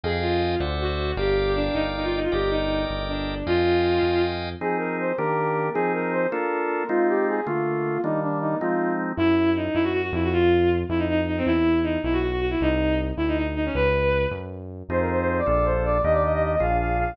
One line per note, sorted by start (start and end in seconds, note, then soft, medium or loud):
0.03 0.56 F2 medium
0.03 0.23 G#4 medium
0.03 0.55 D#5 medium
0.03 0.55 F5 medium
0.03 0.55 G5 medium
0.03 0.55 G#5 medium
0.21 0.57 F4 medium
0.60 1.13 D2 medium
0.60 1.12 C5 medium
0.60 1.12 D5 medium
0.60 1.12 E5 medium
0.60 1.12 F#5 medium
0.81 1.15 F#4 medium
1.17 1.69 G1 medium
1.17 1.51 G4 medium
1.17 2.20 A#4 medium
1.17 2.20 D5 medium
1.17 2.20 F5 medium
1.17 2.20 G5 medium
1.55 1.74 D4 medium
1.73 2.27 G1 medium
1.73 1.83 D#4 medium
1.95 2.04 D#4 medium
2.04 2.13 F4 medium
2.15 2.24 D#4 medium
2.24 2.33 F4 medium
2.32 2.85 G1 medium
2.32 2.48 G4 medium
2.32 3.35 A#4 medium
2.32 3.35 D5 medium
2.32 3.35 D#5 medium
2.32 3.35 G5 medium
2.50 2.82 D#4 medium
2.90 3.43 G1 medium
3.09 3.43 D4 medium
3.47 3.99 F2 medium
3.47 4.22 F4 medium
3.47 4.50 D#5 medium
3.47 4.50 F5 medium
3.47 4.50 G5 medium
3.47 4.50 G#5 medium
4.03 4.55 F2 medium
4.61 5.13 F3 loud
4.61 5.13 C4 medium
4.61 5.13 D#4 loud
4.61 5.13 G#4 loud
4.61 4.77 G#4 loud
4.78 4.96 A#4 medium
4.99 5.16 C5 medium
5.18 5.70 D#3 loud
5.18 5.70 A#3 loud
5.18 5.70 D4 medium
5.18 5.70 G4 loud
5.18 5.68 A#4 loud
5.73 6.27 F3 loud
5.73 6.27 C4 loud
5.73 6.27 D#4 loud
5.73 5.92 G#4 loud
5.73 6.27 G#4 loud
5.93 6.12 A#4 loud
6.12 6.27 C5 loud
6.31 6.84 A#3 loud
6.31 6.84 D4 loud
6.31 6.84 F4 loud
6.31 6.84 A4 loud
6.31 6.86 A#4 loud
6.89 7.41 G#3 loud
6.89 7.41 C4 medium
6.89 7.41 D#4 loud
6.89 7.07 F4 loud
6.89 7.41 F4 medium
7.08 7.25 G4 loud
7.28 7.46 G#4 loud
7.46 7.98 D3 loud
7.46 7.98 A3 loud
7.46 7.98 A#3 loud
7.46 8.01 F4 loud
7.46 7.98 F4 loud
8.03 8.55 D#3 loud
8.03 8.55 G3 loud
8.03 8.55 A#3 loud
8.03 8.55 D4 loud
8.03 8.20 D#4 loud
8.22 8.38 D4 loud
8.40 8.57 D#4 loud
8.59 9.13 F3 loud
8.59 9.13 G#3 loud
8.59 9.13 C4 loud
8.59 9.13 D#4 loud
8.59 8.92 F4 medium
9.17 9.69 F#2 medium
9.17 9.49 E4 loud
9.56 9.74 D#4 medium
9.74 10.11 F#2 medium
9.74 9.83 E4 medium
9.84 9.92 F#4 medium
9.93 10.02 F#4 medium
10.03 10.12 F#4 medium
10.12 10.84 F2 loud
10.12 10.22 E4 medium
10.23 10.33 F#4 medium
10.33 10.69 F4 loud
10.89 11.42 F2 medium
10.89 10.98 E4 medium
10.98 11.07 D#4 medium
11.10 11.19 D#4 medium
11.27 11.36 D#4 medium
11.37 11.46 C4 medium
11.46 11.97 E2 medium
11.46 11.79 E4 medium
11.83 11.99 D#4 medium
12.03 12.55 B1 medium
12.03 12.13 E4 medium
12.13 12.21 F#4 medium
12.22 12.30 F#4 medium
12.31 12.40 F#4 medium
12.41 12.50 F#4 medium
12.50 12.59 E4 medium
12.61 13.12 C2 medium
12.61 12.98 D#4 medium
13.17 13.69 D2 medium
13.17 13.26 E4 medium
13.28 13.37 D#4 medium
13.38 13.47 D#4 medium
13.56 13.65 D#4 medium
13.66 13.75 C#4 medium
13.75 14.26 C#2 medium
13.75 14.24 B4 loud
14.31 14.83 F#2 medium
14.89 15.41 F2 medium
14.89 15.41 C4 medium
14.89 15.41 D#4 medium
14.89 15.41 F4 medium
14.89 15.41 G#4 medium
14.89 14.99 C5 loud
15.01 15.10 A#4 medium
15.10 15.19 C5 loud
15.20 15.28 C5 loud
15.28 15.38 C5 loud
15.38 15.47 D5 loud
15.46 16.00 A#1 medium
15.46 15.98 A#3 medium
15.46 15.98 D4 medium
15.46 15.98 F4 medium
15.46 15.98 A4 medium
15.46 15.65 D5 loud
15.64 15.83 C5 loud
15.84 16.01 D5 loud
16.04 16.56 D#2 medium
16.04 16.56 A#3 medium
16.04 16.56 D4 medium
16.04 16.56 D#4 medium
16.04 16.56 G4 medium
16.04 16.13 D#5 loud
16.13 16.22 D5 loud
16.24 16.33 D#5 loud
16.33 16.42 D#5 loud
16.43 16.51 D#5 loud
16.52 16.61 D#5 loud
16.60 17.13 A#1 medium
16.60 17.12 A#3 medium
16.60 17.12 D4 medium
16.60 17.12 F4 medium
16.60 17.12 G#4 medium
16.60 16.77 F5 loud
16.80 16.97 F5 loud
16.98 17.14 F5 loud